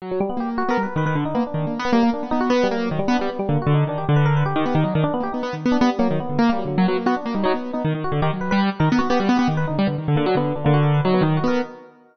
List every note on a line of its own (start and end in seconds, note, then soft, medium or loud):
0.02 0.19 F#3 medium
0.11 0.20 F#3 medium
0.20 0.29 G3 loud
0.30 0.38 B3 loud
0.37 0.63 A#3 medium
0.37 0.49 G4 medium
0.58 0.69 F#4 loud
0.69 0.77 B3 medium
0.69 0.82 A#4 loud
0.78 0.86 G3 medium
0.83 0.95 B4 medium
0.96 1.05 D#3 medium
0.96 1.06 B4 medium
1.06 1.15 D#3 medium
1.06 1.15 B4 medium
1.15 1.24 D3 medium
1.25 1.34 D3 medium
1.25 1.34 D#4 medium
1.35 1.44 A#3 medium
1.35 1.43 B3 medium
1.47 1.73 D4 medium
1.54 1.66 D#3 medium
1.67 1.79 A#3 soft
1.79 1.91 B3 loud
1.85 1.94 B3 medium
1.93 2.03 G3 medium
1.93 2.10 A#3 loud
2.03 2.12 A#3 medium
2.13 2.22 D4 medium
2.23 2.32 B3 medium
2.31 2.50 B3 medium
2.31 2.40 D#4 loud
2.41 2.49 F#4 loud
2.50 2.67 B3 loud
2.50 2.63 B3 medium
2.63 2.75 G3 loud
2.71 2.89 A#3 medium
2.76 2.88 F#3 medium
2.90 3.00 D#3 medium
2.90 2.98 F#3 medium
2.99 3.08 G3 loud
3.08 3.17 B3 loud
3.08 3.19 D4 medium
3.19 3.30 G3 loud
3.19 3.28 B3 medium
3.29 3.38 B3 medium
3.39 3.48 G3 loud
3.49 3.58 D3 medium
3.49 3.60 A#3 medium
3.62 3.73 F#4 medium
3.67 3.84 D3 loud
3.74 3.86 D#4 medium
3.87 4.05 D#3 medium
3.87 3.98 D4 medium
3.98 4.07 G4 medium
4.09 4.44 D3 loud
4.16 4.25 B4 medium
4.26 4.34 A#4 medium
4.37 4.45 B4 medium
4.45 4.54 D3 medium
4.45 4.81 G4 medium
4.56 4.65 D#3 loud
4.66 4.74 B3 medium
4.75 4.84 D#3 loud
4.84 4.93 F#3 medium
4.84 4.93 D#4 medium
4.94 5.04 D#3 loud
4.94 5.02 D4 medium
5.04 5.12 D4 loud
5.14 5.22 B3 loud
5.20 5.29 A#3 soft
5.20 5.32 G4 medium
5.32 5.43 B3 medium
5.32 5.41 D#4 medium
5.43 5.55 B3 medium
5.53 5.65 D#3 medium
5.66 5.77 B3 loud
5.72 5.80 D4 medium
5.81 5.99 G3 medium
5.81 5.90 B3 loud
5.99 6.17 F#3 loud
5.99 6.08 A#3 medium
6.11 6.19 D#3 medium
6.20 6.38 B3 medium
6.29 6.38 D3 medium
6.39 6.50 A#3 loud
6.49 6.64 G3 medium
6.49 6.58 A#3 loud
6.58 6.67 F#3 medium
6.65 6.77 D3 medium
6.65 6.76 F#3 medium
6.77 6.87 F#3 loud
6.77 6.86 A#3 medium
6.87 6.97 F#3 loud
6.87 6.96 B3 medium
6.97 7.06 A#3 medium
7.06 7.15 B3 medium
7.06 7.15 F#4 loud
7.17 7.25 D4 medium
7.26 7.34 A#3 medium
7.34 7.43 G3 medium
7.34 7.43 D#4 medium
7.44 7.52 F#3 loud
7.44 7.54 D#4 loud
7.54 7.71 B3 medium
7.54 7.73 B3 medium
7.73 7.83 B3 medium
7.73 7.82 D#4 medium
7.85 7.93 D#3 loud
7.95 8.03 D#3 medium
8.04 8.13 F#4 medium
8.12 8.21 D3 loud
8.22 8.31 D#3 loud
8.22 8.31 G4 medium
8.33 8.51 F#3 medium
8.41 8.50 B4 medium
8.51 8.70 G3 loud
8.51 8.60 B4 medium
8.80 8.89 D#3 loud
8.80 8.88 A#4 medium
8.90 9.00 B3 loud
8.90 8.98 A#4 medium
8.99 9.09 B3 medium
8.99 9.07 F#4 loud
9.10 9.19 B3 loud
9.10 9.19 G4 loud
9.19 9.29 G3 loud
9.19 9.28 F#4 medium
9.29 9.38 B3 loud
9.37 9.48 B3 loud
9.37 9.54 G4 medium
9.48 9.65 D#3 medium
9.57 9.66 B4 medium
9.67 9.78 D3 medium
9.67 9.76 D#4 medium
9.79 9.87 G3 loud
9.87 9.96 D3 medium
9.87 9.96 B3 medium
9.98 10.07 D#3 medium
10.08 10.17 D3 medium
10.15 10.26 D3 loud
10.15 10.24 A#3 medium
10.26 10.35 F#3 loud
10.26 10.36 D4 medium
10.35 10.53 D3 medium
10.35 10.54 B3 loud
10.55 10.65 D3 medium
10.55 10.64 D4 medium
10.64 11.01 D3 loud
10.64 10.73 A#3 medium
10.74 10.82 F#4 loud
10.83 10.92 A#4 medium
10.94 11.03 B4 medium
11.05 11.22 F#3 loud
11.05 11.14 D#4 medium
11.14 11.23 B3 medium
11.21 11.39 D#3 loud
11.21 11.35 D#4 loud
11.37 11.49 F#4 medium
11.44 11.61 B3 loud
11.44 11.59 A#4 medium